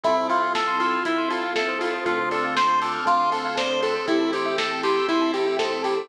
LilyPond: <<
  \new Staff \with { instrumentName = "Lead 1 (square)" } { \time 4/4 \key a \minor \tempo 4 = 119 e'8 f'8 a'8 f'8 e'8 f'8 a'8 f'8 | f'8 a'8 c''8 a'8 f'8 a'8 c''8 a'8 | e'8 g'8 a'8 g'8 e'8 g'8 a'8 g'8 | }
  \new Staff \with { instrumentName = "Electric Piano 2" } { \time 4/4 \key a \minor <c' e' f' a'>8 <c' e' f' a'>4 <c' e' f' a'>4 <c' e' f' a'>4 <c' e' f' a'>8 | <c' d' f' a'>8 <c' d' f' a'>4 <c' d' f' a'>4 <c' d' f' a'>4 <c' d' f' a'>8 | <c' e' g' a'>8 <c' e' g' a'>4 <c' e' g' a'>4 <c' e' g' a'>4 <c' e' g' a'>8 | }
  \new Staff \with { instrumentName = "Tubular Bells" } { \time 4/4 \key a \minor a'16 c''16 e''16 f''16 a''16 c'''16 e'''16 f'''16 e'''16 c'''16 a''16 f''16 e''16 c''16 a'16 c''16 | a'16 c''16 d''16 f''16 a''16 c'''16 d'''16 f'''16 d'''16 c'''16 a''16 f''16 d''16 c''16 a'16 c''16 | g'16 a'16 c''16 e''16 g''16 a''16 c'''16 e'''16 c'''16 a''16 g''16 e''16 c''16 a'16 g'16 a'16 | }
  \new Staff \with { instrumentName = "Synth Bass 1" } { \clef bass \time 4/4 \key a \minor c,2 c,2 | d,2 d,2 | a,,2 a,,2 | }
  \new Staff \with { instrumentName = "Pad 2 (warm)" } { \time 4/4 \key a \minor <c' e' f' a'>2 <c' e' a' c''>2 | <c' d' f' a'>2 <c' d' a' c''>2 | <c' e' g' a'>2 <c' e' a' c''>2 | }
  \new DrumStaff \with { instrumentName = "Drums" } \drummode { \time 4/4 <hh bd>8 hho8 <bd sn>8 hho8 <hh bd>8 hho8 <bd sn>8 hho8 | <hh bd>8 hho8 <bd sn>8 hho8 <hh bd>8 hho8 <bd sn>8 hho8 | <hh bd>8 hho8 <bd sn>8 hho8 <hh bd>8 hho8 <bd sn>8 hho8 | }
>>